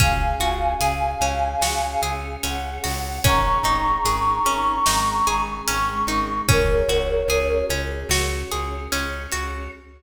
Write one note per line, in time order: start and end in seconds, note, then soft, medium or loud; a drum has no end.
0.00 0.35 C#2 medium
0.00 1.21 C#4 medium
0.00 1.60 C#4 medium
0.00 1.60 F#4 medium
0.00 1.60 G#4 medium
0.00 2.02 F5 medium
0.00 2.02 G#5 loud
0.00 kick loud
0.00 closed hi-hat loud
0.40 0.74 C#2 medium
0.40 1.62 F#4 medium
0.40 closed hi-hat medium
0.80 1.15 C#2 medium
0.80 2.02 G#4 medium
0.80 closed hi-hat loud
1.21 1.55 C#2 medium
1.21 2.43 C#4 medium
1.21 closed hi-hat medium
1.61 1.96 C#2 medium
1.61 3.23 C#4 medium
1.61 2.83 F#4 medium
1.61 3.23 G#4 medium
1.61 3.23 C#5 medium
1.61 snare loud
2.02 2.36 C#2 medium
2.02 3.18 G#4 medium
2.02 closed hi-hat medium
2.43 2.79 C#2 medium
2.43 3.20 C#4 medium
2.43 3.18 F#5 loud
2.43 closed hi-hat loud
2.84 3.19 C#2 medium
2.84 3.22 F#4 medium
2.84 open hi-hat medium
3.24 3.58 G#1 medium
3.24 4.45 C#4 medium
3.24 4.85 C#4 medium
3.24 4.85 D#4 medium
3.24 4.85 G#4 medium
3.24 5.41 A#5 medium
3.24 5.41 C#6 loud
3.24 kick loud
3.24 closed hi-hat loud
3.63 3.98 G#1 medium
3.63 4.86 D#4 medium
3.63 closed hi-hat medium
4.05 4.39 G#1 medium
4.05 5.27 G#4 medium
4.05 closed hi-hat loud
4.45 4.80 G#1 medium
4.45 5.67 C#4 medium
4.45 closed hi-hat medium
4.86 5.22 G#1 medium
4.86 6.48 G#3 medium
4.86 6.48 C#4 medium
4.86 6.08 D#4 medium
4.86 6.48 G#4 medium
4.86 snare loud
5.27 5.62 G#1 medium
5.27 6.43 G#4 medium
5.27 closed hi-hat medium
5.67 6.04 G#1 medium
5.67 6.45 C#4 medium
5.67 6.41 C#6 medium
5.67 closed hi-hat loud
6.07 6.42 G#1 medium
6.07 6.47 D#4 medium
6.07 closed hi-hat medium
6.48 6.83 C#2 medium
6.48 7.70 C#4 medium
6.48 8.10 C#4 medium
6.48 8.10 F#4 medium
6.48 8.10 G#4 medium
6.48 7.65 A#4 medium
6.48 7.65 C#5 loud
6.48 kick loud
6.48 closed hi-hat loud
6.89 7.23 C#2 medium
6.89 8.10 F#4 medium
6.89 closed hi-hat medium
7.28 7.63 C#2 medium
7.28 8.51 G#4 medium
7.28 closed hi-hat medium
7.69 8.04 C#2 medium
7.69 8.92 C#4 medium
7.69 closed hi-hat medium
8.09 8.44 C#2 medium
8.09 9.71 C#4 medium
8.09 9.32 F#4 medium
8.09 9.71 G#4 medium
8.09 9.71 C#5 medium
8.09 snare loud
8.52 8.88 C#2 medium
8.52 9.67 G#4 medium
8.52 closed hi-hat medium
8.92 9.27 C#2 medium
8.92 9.69 C#4 medium
8.92 closed hi-hat loud
9.32 9.68 C#2 medium
9.32 9.71 F#4 medium
9.32 closed hi-hat medium